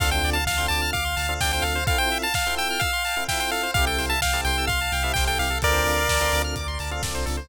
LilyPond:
<<
  \new Staff \with { instrumentName = "Lead 1 (square)" } { \time 4/4 \key d \minor \tempo 4 = 128 f''16 g''8 a''16 f''8 a''8 f''4 g''16 g''16 f''8 | f''16 g''8 a''16 f''8 g''8 f''4 g''16 g''16 f''8 | f''16 g''8 a''16 f''8 g''8 f''4 g''16 g''16 f''8 | <bes' d''>2 r2 | }
  \new Staff \with { instrumentName = "Electric Piano 1" } { \time 4/4 \key d \minor <c' d' f' a'>4~ <c' d' f' a'>16 <c' d' f' a'>4. <c' d' f' a'>16 <c' d' f' a'>4 | <c' e' f' a'>4~ <c' e' f' a'>16 <c' e' f' a'>4. <c' e' f' a'>16 <c' e' f' a'>4 | <c' e' g' a'>4~ <c' e' g' a'>16 <c' e' g' a'>4. <c' e' g' a'>16 <c' e' g' a'>4 | <c' d' f' a'>4~ <c' d' f' a'>16 <c' d' f' a'>4. <c' d' f' a'>16 <c' d' f' a'>4 | }
  \new Staff \with { instrumentName = "Lead 1 (square)" } { \time 4/4 \key d \minor a'16 c''16 d''16 f''16 a''16 c'''16 d'''16 f'''16 d'''16 c'''16 a''16 f''16 d''16 c''16 a'16 c''16 | a'16 c''16 e''16 f''16 a''16 c'''16 e'''16 f'''16 e'''16 c'''16 a''16 f''16 e''16 c''16 a'16 c''16 | g'16 a'16 c''16 e''16 g''16 a''16 c'''16 e'''16 c'''16 a''16 g''16 e''16 c''16 a'16 g'16 a'16 | a'16 c''16 d''16 f''16 a''16 c'''16 d'''16 f'''16 d'''16 c'''16 a''16 f''16 d''16 c''16 a'16 c''16 | }
  \new Staff \with { instrumentName = "Synth Bass 2" } { \clef bass \time 4/4 \key d \minor d,8 d,8 d,8 d,8 d,8 d,8 d,8 d,8 | r1 | c,8 c,8 c,8 c,8 c,8 c,8 c,8 c,8 | d,8 d,8 d,8 d,8 d,8 d,8 c,8 cis,8 | }
  \new DrumStaff \with { instrumentName = "Drums" } \drummode { \time 4/4 <cymc bd>16 hh16 hho16 hh16 <bd sn>16 hh16 hho16 hh16 <hh bd>16 hh16 hho16 hh16 <bd sn>16 hh16 hho16 hh16 | <hh bd>16 hh16 hho16 hh16 <bd sn>16 hh16 hho16 hh16 <hh bd>16 hh16 hho16 hh16 <bd sn>16 hh16 hho16 hh16 | <hh bd>16 hh16 hho16 hh16 <bd sn>16 hh16 hho16 hh16 <hh bd>16 hh16 hho16 hh16 <bd sn>16 hh16 hho16 hh16 | <hh bd>16 hh16 hho16 hh16 <bd sn>16 hh16 hho16 hh16 <hh bd>16 hh16 hho16 hh16 <bd sn>16 hh16 hho16 hh16 | }
>>